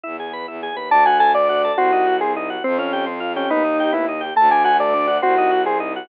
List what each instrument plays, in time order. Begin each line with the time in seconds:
0.03 violin E2, drawbar organ E4
0.20 drawbar organ G#4
0.33 drawbar organ B4
0.48 violin E2, drawbar organ E4
0.63 drawbar organ G#4
0.71 violin D#2
0.76 drawbar organ B4
0.89 violin D2, drawbar organ D4, lead 1 (square) A5
1.05 drawbar organ F#4, lead 1 (square) G#5
1.20 drawbar organ A4, lead 1 (square) G#5
1.34 drawbar organ D4, lead 1 (square) D5
1.49 drawbar organ F#4
1.64 drawbar organ A4
1.77 violin C2, drawbar organ C4, lead 1 (square) F#4
1.92 drawbar organ D#4
2.07 drawbar organ F#4
2.21 drawbar organ C4, lead 1 (square) G#4
2.36 drawbar organ D#4
2.50 drawbar organ F#4
2.64 violin F2, lead 1 (square) C4, drawbar organ C4
2.78 lead 1 (square) C#4, drawbar organ F4
2.93 drawbar organ G4
3.06 drawbar organ C4
3.20 drawbar organ F4
3.36 lead 1 (square) C#4, drawbar organ G4
3.50 violin D#2, drawbar organ B3, lead 1 (square) D#4
3.64 drawbar organ D#4
3.80 drawbar organ G4
3.93 drawbar organ B3, lead 1 (square) E4
4.09 drawbar organ D#4
4.21 drawbar organ G4
4.36 violin D2, drawbar organ A3, lead 1 (square) A5
4.51 drawbar organ D4, lead 1 (square) G#5
4.64 drawbar organ F#4, lead 1 (square) G#5
4.80 drawbar organ A3, lead 1 (square) D5
4.94 drawbar organ D4
5.08 drawbar organ F#4
5.22 violin C2, drawbar organ C4, lead 1 (square) F#4
5.38 drawbar organ D#4
5.51 drawbar organ F#4
5.66 drawbar organ C4, lead 1 (square) G#4
5.80 drawbar organ D#4
5.96 drawbar organ F#4